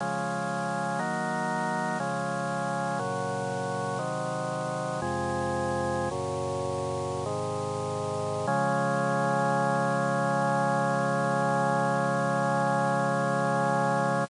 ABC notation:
X:1
M:4/4
L:1/8
Q:1/4=60
K:Db
V:1 name="Drawbar Organ"
[D,F,A,]2 [E,G,B,]2 [D,F,A,]2 [B,,D,G,]2 | "^rit." [C,E,G,]2 [F,,C,A,]2 [G,,B,,D,]2 [A,,C,E,]2 | [D,F,A,]8 |]